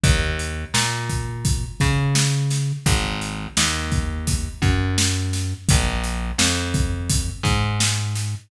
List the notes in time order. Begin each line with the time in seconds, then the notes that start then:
0.04 D#2, kick, closed hi-hat
0.39 closed hi-hat
0.74 A#2, snare
1.09 kick, closed hi-hat
1.45 kick, closed hi-hat
1.80 C#3, kick, closed hi-hat
2.15 snare
2.50 snare, closed hi-hat
2.86 G#1, kick, closed hi-hat
3.21 closed hi-hat
3.57 D#2, snare
3.92 kick, snare, closed hi-hat
4.27 kick, closed hi-hat
4.62 F#2, kick, closed hi-hat
4.98 snare
5.33 snare, closed hi-hat
5.69 A#1, kick, closed hi-hat
6.04 closed hi-hat
6.38 F2, snare
6.74 kick, closed hi-hat
7.10 kick, closed hi-hat
7.43 G#2, kick, snare, closed hi-hat
7.80 snare
8.15 snare, closed hi-hat